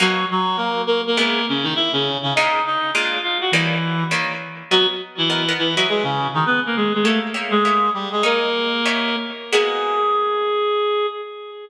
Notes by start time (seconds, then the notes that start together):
0.00 B2 F#3 A#3 D#4 F#4
0.31 F#3 F#4
0.57 A#3 A#4
0.87 A#3 A#4
1.07 A#3 A#4
1.17 C#3 G#3 A#3 B3 E4 A#4
1.49 C#3 C#4
1.63 D#3 D#4
1.75 E4 E5
1.93 C#3 C#4
2.23 C#3 C#4
2.35 A#2 G#3 D#4 F4 D#5
2.66 D#4 D#5
2.94 A#2 G#3 D4 F4 F5
3.23 F4 F5
3.41 F#4 F#5
3.52 D#3 E3 G3 A#3 C#4 E4
4.11 D#3 G3 A#3 C#4
4.71 F#3 B3 F#4 A#4 D#5 F#5
5.18 E3 E4
5.30 B3 A#4 D#5 F#5
5.49 B3 A#4 D#5 F#5
5.58 E3 E4
5.76 F#3 E4 F#4 G#4 B4 D#5
5.89 G#3 G#4
6.03 C#3 C#4
6.34 D#3 D#4
6.46 B3 B4
6.66 A#3 A#4
6.76 G#3 G#4
6.94 G#3 G#4
7.03 A3 A#3 G4 A4 C#5 E5
7.34 A#3 G4 C#5 E5
7.51 G#3 G#4
7.65 A#3 G4 C#5 E5
7.94 G3 G4
8.12 G#3 G#4
8.23 A#3 D#4 G#4 A#4 C#5
8.86 D#4 G4 C#5 E5
9.52 G#3 A#3 B3 F#4 G#4